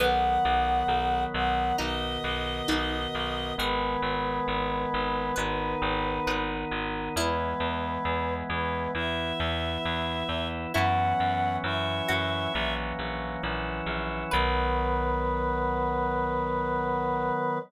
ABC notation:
X:1
M:4/4
L:1/8
Q:1/4=67
K:B
V:1 name="Choir Aahs"
f3 f d4 | B7 z | B3 B e4 | f2 e3 z3 |
B8 |]
V:2 name="Harpsichord"
B,4 D2 D z | G4 B2 B z | E8 | E3 F3 z2 |
B8 |]
V:3 name="Drawbar Organ"
[D,F,B,]4 [B,,D,B,]4 | [D,G,B,]4 [D,B,D]4 | [E,G,B,]4 [E,B,E]4 | [E,F,B,C]2 [E,F,CE]2 [E,F,A,C]2 [E,F,CE]2 |
[D,F,B,]8 |]
V:4 name="Electric Bass (finger)" clef=bass
B,,, B,,, B,,, B,,, B,,, B,,, B,,, B,,, | G,,, G,,, G,,, G,,, G,,, G,,, G,,, G,,, | E,, E,, E,, E,, E,, E,, E,, E,, | F,, F,, F,, F,, A,,, A,,, A,,, A,,, |
B,,,8 |]